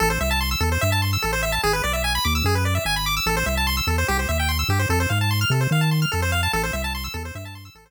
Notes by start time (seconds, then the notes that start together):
0.00 A1 A4
0.10 C5
0.21 C2 E5
0.31 A5
0.41 C6
0.51 E6
0.60 E2 A4
0.72 C5
0.81 G2 E5
0.92 A5
1.02 C6
1.13 E6
1.22 A1 A4
1.33 C5
1.43 E5
1.52 A5
1.63 G#1 G#4
1.73 B4
1.84 B1 D5
1.93 E5
2.04 G#5
2.15 B5
2.25 D#2 D6
2.35 E6
2.44 F#2 G#4
2.55 B4
2.65 D5
2.75 E5
2.85 G#1 G#5
2.96 B5
3.06 D6
3.17 E6
3.26 A1 A4
3.37 C5
3.46 C2 E5
3.57 A5
3.67 C6
3.77 E6
3.87 E2 A4
3.98 C5
4.08 C2 G4
4.19 C5
4.29 D#2 E5
4.40 G5
4.49 C6
4.59 E6
4.69 G2 G4
4.79 C5
4.89 F2 A4
5.00 C5
5.10 G#2 F5
5.21 A5
5.31 C6
5.41 F6
5.50 C3 A4
5.61 C5
5.71 D#3 F5
5.81 A5
5.91 C6
6.02 F6
6.12 F2 A4
6.22 C5
6.32 F5
6.43 A5
6.53 A1 A4
6.64 C5
6.73 C2 E5
6.84 A5
6.95 C6
7.04 E6
7.14 E2 A4
7.25 C5
7.35 G2 E5
7.45 A5
7.55 C6
7.65 E6
7.75 A1 A4
7.86 C5